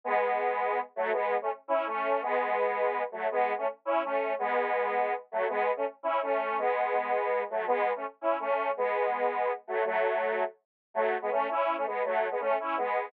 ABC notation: X:1
M:6/8
L:1/16
Q:3/8=110
K:E
V:1 name="Lead 1 (square)"
[G,B,]10 [F,A,]2 | [G,B,]3 [A,C] z2 [CE]2 [A,C]4 | [G,B,]10 [F,A,]2 | [G,B,]3 [A,C] z2 [CE]2 [A,C]4 |
[G,B,]10 [F,A,]2 | [G,B,]3 [A,C] z2 [CE]2 [A,C]4 | [G,B,]10 [F,A,]2 | [G,B,]3 [A,C] z2 [CE]2 [A,C]4 |
[G,B,]10 [F,A,]2 | [F,A,]8 z4 | [K:A] [F,A,]3 [G,B,] [A,C]2 [CE]3 [A,C] [G,B,]2 | [F,A,]3 [G,B,] [A,C]2 [CE]2 [G,B,]4 |]